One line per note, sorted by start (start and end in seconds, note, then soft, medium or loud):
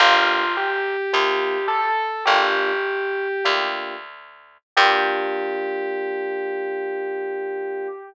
0.00 0.97 G1 loud
0.00 0.44 A#3 medium
0.00 0.44 D4 medium
0.00 0.44 F4 medium
0.00 0.52 F4 loud
0.00 0.44 G4 medium
0.57 1.66 G4 loud
1.13 2.11 D2 medium
1.13 1.58 A#3 medium
1.13 1.58 D4 medium
1.13 1.58 F4 medium
1.13 1.58 G4 medium
1.68 2.23 A4 loud
2.25 3.28 G1 medium
2.25 2.72 A#3 medium
2.25 2.72 D4 medium
2.25 2.72 F4 medium
2.25 3.47 G4 loud
2.25 2.72 G4 medium
3.45 4.58 D2 medium
3.45 3.95 A#3 medium
3.45 3.95 D4 medium
3.45 3.95 F4 medium
3.45 3.95 G4 medium
4.77 7.88 G2 loud
4.77 7.88 A#3 loud
4.77 7.88 D4 loud
4.77 7.88 F4 loud
4.77 7.88 G4 loud
4.77 7.88 G4 medium